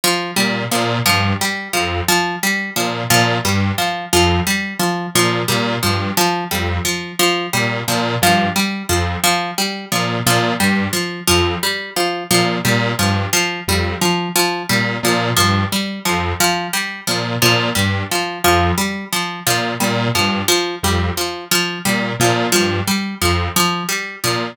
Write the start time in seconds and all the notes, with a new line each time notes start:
0.04 F3
0.36 A#2 G3
0.71 A#2 F3
1.06 G2 F3
1.41 G3
1.73 F2 F3
2.09 F3
2.43 G3
2.76 A#2 F3
3.10 A#2 F3
3.44 G2 G3
3.78 F3
4.13 F2 F3
4.47 G3
4.80 F3
5.15 A#2 F3
5.48 A#2 G3
5.83 G2 F3
6.17 F3
6.51 F2 G3
6.85 F3
7.19 F3
7.53 A#2 G3
7.88 A#2 F3
8.22 G2 F3
8.56 G3
8.89 F2 F3
9.24 F3
9.58 G3
9.92 A#2 F3
10.26 A#2 F3
10.60 G2 G3
10.93 F3
11.28 F2 F3
11.63 G3
11.96 F3
12.31 A#2 F3
12.65 A#2 G3
12.99 G2 F3
13.33 F3
13.68 F2 G3
14.01 F3
14.36 F3
14.69 A#2 G3
15.03 A#2 F3
15.37 G2 F3
15.72 G3
16.05 F2 F3
16.40 F3
16.73 G3
17.07 A#2 F3
17.42 A#2 F3
17.75 G2 G3
18.12 F3
18.44 F2 F3
18.78 G3
19.13 F3
19.47 A#2 F3
19.80 A#2 G3
20.15 G2 F3
20.48 F3
20.83 F2 G3
21.17 F3
21.51 F3
21.85 A#2 G3
22.19 A#2 F3
22.52 G2 F3
22.87 G3
23.22 F2 F3
23.56 F3
23.89 G3
24.24 A#2 F3